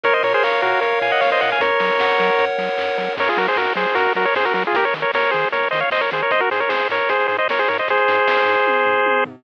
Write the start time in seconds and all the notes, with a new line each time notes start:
0.04 A#1 A#4 C#5, kick, closed hi-hat
0.13 C5 D#5
0.23 A#2 A#4 C#5, open hi-hat
0.34 G#4 C5
0.43 A#1 A#4 C#5 F5, kick, clap
0.62 A#2 F#4 A#4, open hi-hat
0.81 A#1 A#4 C#5, kick, closed hi-hat
1.01 A#2 F5 G#5, open hi-hat
1.12 D#5 F#5
1.21 A#1 A#4 C#5 F5, kick, snare
1.32 C5 D#5
1.41 A#2 C#5 D#5 F#5, open hi-hat
1.52 F5 G#5
1.60 F#2 A#4 C#5, kick, closed hi-hat
1.80 F#3 C#5, open hi-hat
2.00 F#2 F#5, kick, snare
2.18 F#3 A#4, open hi-hat
2.39 F#2 C#5, kick, closed hi-hat
2.57 F#3 F#5, open hi-hat
2.78 F#2 A#4, kick, clap
2.97 F#3 C#5, open hi-hat
3.17 F#2 A#4 C#5, kick, crash
3.28 F4 G#4, closed hi-hat
3.37 F#3 F#4 A#4, snare, open hi-hat
3.47 G#4 C5, closed hi-hat
3.56 F#2 F#4 A#4, kick, clap
3.66 closed hi-hat
3.75 F#3 G#4 C5, open hi-hat
3.86 closed hi-hat
3.95 F#2 F#4 A#4, kick, closed hi-hat
4.06 closed hi-hat
4.15 F#3 F#4 A#4, open hi-hat
4.25 A#4 C#5, closed hi-hat
4.35 F#2 G#4 C5, kick, snare
4.45 F#4 A#4, closed hi-hat
4.54 F#3 F#4 A#4, open hi-hat
4.64 F4 G#4, closed hi-hat
4.73 D#2 G4 A#4, kick, closed hi-hat
4.84 A#4 C#5, closed hi-hat
4.94 D#3, snare, open hi-hat
5.02 A#4 C#5, closed hi-hat
5.14 D#2 A#4 C#5, kick, snare
5.23 closed hi-hat
5.31 D#3 G#4 C5, open hi-hat
5.43 closed hi-hat
5.52 D#2 A#4 C#5, kick, closed hi-hat
5.63 closed hi-hat
5.71 D#3 C5 D#5, open hi-hat
5.80 C#5 F5, closed hi-hat
5.90 D#2 C5 D#5, kick, clap
6.01 A#4 C#5, closed hi-hat
6.11 D#3 G#4 C5, open hi-hat
6.22 A#4 C#5, closed hi-hat
6.30 G#1 C5 D#5, kick, closed hi-hat
6.40 F#4 A#4, closed hi-hat
6.51 G#2 G#4 C5, snare, open hi-hat
6.60 A#4 C#5, closed hi-hat
6.69 G#1 G#4 C5, kick, snare
6.80 closed hi-hat
6.89 G#2 A#4 C#5, open hi-hat
7.00 closed hi-hat
7.09 G#1 G#4 C5, kick, closed hi-hat
7.20 closed hi-hat
7.28 G#2 G#4 C5, open hi-hat
7.38 C5 D#5, closed hi-hat
7.48 G#1 A#4 C#5, kick, snare
7.59 G#4 C5, closed hi-hat
7.68 G#2 A#4 C#5, open hi-hat
7.78 C5 D#5, closed hi-hat
7.88 G#1 G#4 C5, kick, closed hi-hat
7.97 closed hi-hat
8.08 G#2, snare, open hi-hat
8.17 closed hi-hat
8.27 G#1, kick, snare
8.37 closed hi-hat
8.45 G#2, open hi-hat
8.57 closed hi-hat
8.65 G#1, kick, high tom
8.86 G#2, floor tom
9.05 G#1, high tom
9.25 G#2, floor tom